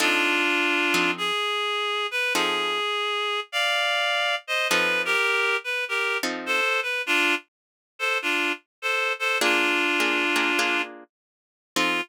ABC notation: X:1
M:4/4
L:1/8
Q:"Swing" 1/4=102
K:F
V:1 name="Clarinet"
[DF]4 _A3 =B | _A4 [df]3 [c_e] | _c [GB]2 c [GB] z [A=c] =B | [DF] z2 [Ac] [DF] z [Ac] [Ac] |
[DF]5 z3 | F2 z6 |]
V:2 name="Acoustic Guitar (steel)"
[F,C_EA]3 [F,CEA]5 | [F,C_EA]8 | [F,C_EA]5 [F,CEA]3 | z8 |
[B,DF_A]2 [B,DFA] [B,DFA] [B,DFA]4 | [F,C_EA]2 z6 |]